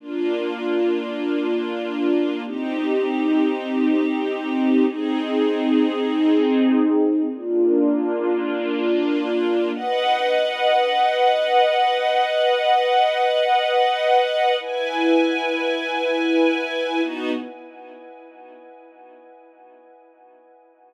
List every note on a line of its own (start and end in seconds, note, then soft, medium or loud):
0.00 2.41 A#3 medium
0.00 2.41 D4 medium
0.00 2.41 F4 medium
2.44 4.85 C4 medium
2.44 4.85 D#4 medium
2.44 4.85 G4 medium
4.86 7.27 C4 medium
4.86 7.27 D#4 medium
4.86 7.27 G#4 medium
7.29 9.70 A#3 medium
7.29 9.70 D4 medium
7.29 9.70 F4 medium
9.73 14.55 B4 medium
9.73 14.55 D#5 medium
9.73 14.55 F#5 medium
14.60 17.01 E4 medium
14.60 17.01 B4 medium
14.60 17.01 G#5 medium
17.01 17.30 B3 medium
17.01 17.30 D#4 medium
17.01 17.30 F#4 loud